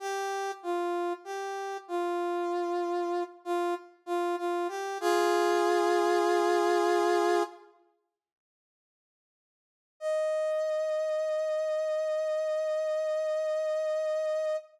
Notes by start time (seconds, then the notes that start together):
0.00 G4
0.63 F4
1.24 G4
1.88 F4
3.45 F4
4.06 F4
4.38 F4
4.68 G4
5.01 F4 G#4
10.00 D#5